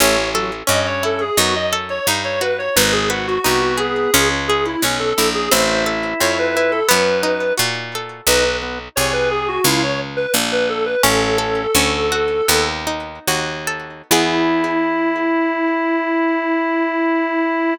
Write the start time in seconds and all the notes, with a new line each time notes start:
0.00 A1 A3 C#4 C#5
0.34 F#3 A4
0.67 G2 C#4 D#5
0.86 C#5
1.03 E4 A4
1.21 G#4
1.37 F#2 B3 D#4 F#4
1.56 D#5
1.73 A4
1.90 C#5
2.07 G2 D#4
2.25 C#5
2.41 F#4 B4
2.58 C#5
2.76 G#1 D#4 B4
2.92 G#4
3.10 F#4 B4
3.27 F#4
3.44 C2 B3 D#4 F#4
3.62 F#4
3.77 G#4
4.14 C#2 C#4
4.48 G#4
4.66 E4
4.82 B1 C#4
4.99 A4
5.18 A#1 E4
5.35 G#4
5.51 A1 C4 E4 C5
5.86 A4
6.20 F2 C4 C#5
6.39 B4
6.55 E4 B4
6.71 A4
6.89 F#2 B3 B4
7.23 D#4
7.57 A#2 F#4
7.95 A4
8.27 B1 D#4 B4
8.62 B3
8.96 C2 G#4 C#5
9.13 B4
9.31 G#4
9.48 F#4
9.64 C#2 E4 F4
9.83 C#5
10.17 B4
10.34 A#1
10.52 B4
10.69 A4
10.85 B4
11.03 A1 C#4 A4
11.38 A4
11.75 D2 C#4
12.12 F#4
12.48 D#2 B3
12.87 D#4
13.27 D#2 F#4
13.67 A4
14.11 E2 B3 E4 G#4